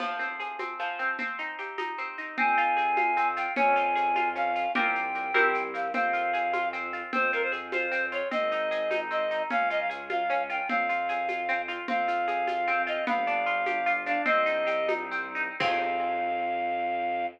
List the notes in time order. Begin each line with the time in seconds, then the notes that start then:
0.00 F3, crash, low conga, shaker
0.19 C4, shaker
0.40 G#4, shaker
0.59 C4, high conga, shaker
0.79 F3, shaker
0.99 C4, shaker
1.19 C4, low conga, shaker
1.39 D#4, shaker
1.58 G4, shaker
1.78 D#4, high conga, shaker
1.98 C4, shaker
2.18 D#4, shaker
2.37 F2 C4 G#5, low conga, shaker
2.57 F4, shaker
2.77 G#4, shaker
2.97 F4, high conga, shaker
3.17 C4, shaker
3.37 F4 G5, shaker
3.56 F2 C#4 G#5, low conga, shaker
3.76 F4, shaker
3.96 G#4, shaker
4.16 F4, high conga, shaker
4.36 C#4 F5, shaker
4.55 F4, shaker
4.75 C2 C4 F4 G4 A#4 G5, low conga, shaker
4.95 shaker
5.15 shaker
5.34 C2 C4 E4 G4 A#4, high conga, shaker
5.54 shaker
5.74 F5, shaker
5.93 F2 C4 F5, low conga, shaker
6.13 F4, shaker
6.33 G#4, shaker
6.53 F4, high conga, shaker
6.73 C4, shaker
6.93 F4, shaker
7.13 F2 C4 C5, low conga, shaker
7.33 F4 A#4, shaker
7.43 C5
7.52 G#4, shaker
7.72 F4 C5, high conga, shaker
7.92 C4, shaker
8.12 F4 C#5, shaker
8.31 G#1 C4 D#5, low conga, shaker
8.52 D#4, shaker
8.71 G#4, shaker
8.91 D#4, high conga, shaker
9.11 C4 D#5, shaker
9.31 D#4, shaker
9.50 C#2 C#4 F5, low conga, shaker
9.70 F4 D#5, shaker
9.80 F5
9.90 G#4, shaker
10.10 F4 F5, high conga, shaker
10.30 C#4, shaker
10.50 F4 G5, shaker
10.69 F2 C4 F5, low conga, shaker
10.89 F4, shaker
11.09 G#4, shaker
11.29 F4, high conga, shaker
11.49 C4, shaker
11.68 F4, shaker
11.88 F2 C4 F5, low conga, shaker
12.08 F4, shaker
12.28 G#4, shaker
12.47 F4, high conga, shaker
12.67 C4, shaker
12.87 F4 D#5, shaker
13.07 G1 B3 F5, low conga, shaker
13.27 D4, shaker
13.46 F4, shaker
13.66 G4, high conga, shaker
13.86 F4, shaker
14.06 D4 F5, shaker
14.26 C2 C4 D#5, low conga, shaker
14.46 D#4, shaker
14.67 G4, shaker
14.88 D#4, high conga, shaker
15.11 C4, shaker
15.35 D#4, shaker
15.59 F2 C4 F4 G#4 F5, kick, crash